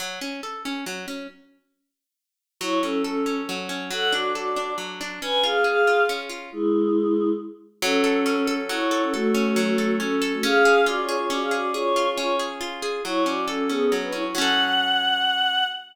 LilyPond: <<
  \new Staff \with { instrumentName = "Choir Aahs" } { \time 3/4 \key fis \minor \tempo 4 = 138 r2. | r2. | <e' cis''>8 <cis' a'>8 <cis' a'>4 r4 | <a' fis''>8 <fis' d''>8 <fis' d''>4 r4 |
<b' gis''>8 <gis' eis''>8 <gis' eis''>4 r4 | <gis e'>2 r4 | <cis' a'>2 <e' cis''>8 <e' cis''>16 <cis' a'>16 | <a fis'>2 <cis' a'>8 <cis' a'>16 <a fis'>16 |
<gis' eis''>4 \tuplet 3/2 { <fis' d''>8 <eis' cis''>8 <eis' cis''>8 } <fis' d''>16 <gis' eis''>16 <fis' d''>8 | <eis' cis''>4 <eis' cis''>8 r4. | <e' cis''>8 <fis' d''>8 <cis' a'>8 <b gis'>8 r16 <d' b'>16 <e' cis''>16 <e' cis''>16 | fis''2. | }
  \new Staff \with { instrumentName = "Orchestral Harp" } { \time 3/4 \key fis \minor fis8 cis'8 a'8 cis'8 fis8 cis'8 | r2. | fis8 cis'8 a'8 cis'8 fis8 cis'8 | fis8 d'8 a'8 d'8 fis8 d'8 |
cis'8 eis'8 gis'8 eis'8 cis'8 eis'8 | r2. | fis8 a'8 cis'8 a'8 fis8 a'8 | a'8 cis'8 fis8 a'8 cis'8 a'8 |
cis'8 gis'8 eis'8 gis'8 cis'8 gis'8 | gis'8 eis'8 cis'8 gis'8 eis'8 gis'8 | fis8 cis'8 a'8 cis'8 fis8 cis'8 | <fis cis' a'>2. | }
>>